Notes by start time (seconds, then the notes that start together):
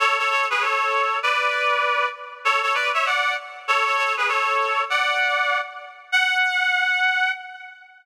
0.00 A4 C#5
0.19 A4 C#5
0.30 A4 C#5
0.50 G#4 B4
0.61 A4 C#5
1.23 B4 D5
2.45 A4 C#5
2.62 A4 C#5
2.75 B4 D5
2.94 C#5 E5
3.06 D5 F#5
3.68 A4 C#5
3.85 A4 C#5
3.97 A4 C#5
4.17 G#4 B4
4.28 A4 C#5
4.90 D5 F#5
6.12 F#5